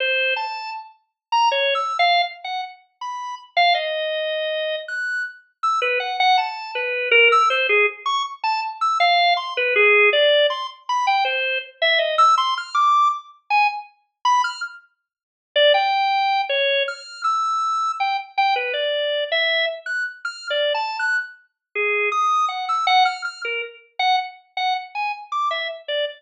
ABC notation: X:1
M:5/4
L:1/16
Q:1/4=80
K:none
V:1 name="Drawbar Organ"
c2 a2 z3 ^a (3^c2 e'2 f2 z ^f z2 b2 z =f | ^d6 ^f'2 z2 e' B ^f f a2 B2 ^A e' | c ^G z ^c' z a z e' f2 =c' B G2 d2 c' z b =g | c2 z e ^d e' c' f' =d'2 z2 ^g z3 b f' z2 |
z3 d g4 ^c2 f'2 e'4 g z g B | d3 e2 z ^f' z (3=f'2 d2 a2 ^f' z3 ^G2 ^d'2 | ^f e' f =f' f' ^A z2 ^f z2 f z ^g z d' e z d z |]